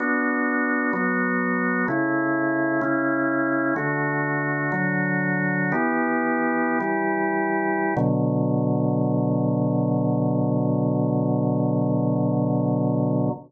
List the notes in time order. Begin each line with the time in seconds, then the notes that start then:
0.00 B3 D4 F#4
0.93 F#3 B3 F#4
1.88 C#3 A3 E4
2.81 C#3 C#4 E4
3.76 D3 A3 F#4
4.72 D3 F#3 F#4
5.72 E3 B3 G4
6.81 E3 G3 G4
7.97 B2 D3 F#3